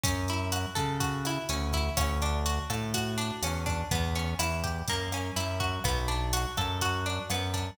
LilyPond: <<
  \new Staff \with { instrumentName = "Acoustic Guitar (steel)" } { \time 4/4 \key b \minor \tempo 4 = 124 cis'8 e'8 fis'8 a'8 fis'8 e'8 cis'8 e'8 | cis'8 d'8 fis'8 a'8 fis'8 d'8 cis'8 d'8 | b8 cis'8 e'8 g'8 ais8 cis'8 e'8 fis'8 | b8 d'8 fis'8 a'8 fis'8 d'8 b8 d'8 | }
  \new Staff \with { instrumentName = "Synth Bass 1" } { \clef bass \time 4/4 \key b \minor fis,4. cis4. d,4 | d,4. a,4. e,4 | e,4 e,4 fis,4 fis,4 | b,,4. fis,4. fis,4 | }
  \new DrumStaff \with { instrumentName = "Drums" } \drummode { \time 4/4 <hh bd>8 hh8 <hh ss>8 <hh bd>8 <hh bd>8 <hh ss>8 hh8 <hh bd>8 | <hh bd ss>8 hh8 hh8 <hh bd ss>8 <hh bd>8 hh8 <hh ss>8 <hh bd>8 | <hh bd>8 hh8 <hh ss>8 <hh bd>8 <hh bd>8 <hh ss>8 hh8 <hh bd>8 | <hh bd ss>8 hh8 hh8 <hh bd ss>8 <hh bd>8 hh8 <hh ss>8 <hh bd>8 | }
>>